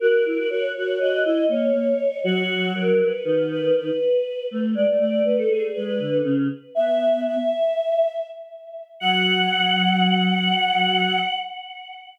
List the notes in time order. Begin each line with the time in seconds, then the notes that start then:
0.00 F#4 A#4
0.26 E4
0.37 F#4
0.50 F#4 C#5
0.76 F#4 C#5
0.99 F#4 D#5
1.25 E4 D#5
1.49 A#3 C#5
1.73 A#3
2.24 F#3 F#4
2.75 A#4
2.99 B4
3.24 D#3 B4
3.51 B4
3.76 B4
4.51 A3
4.75 G#3 D5
4.88 A3
4.99 A3 D5
5.24 A3 B4
5.38 A4
5.49 A3 G#4
5.74 G#3 B4
5.86 B4
5.99 D3
6.24 C#3
6.75 B3 E5
7.26 E5
9.00 F#3 F#5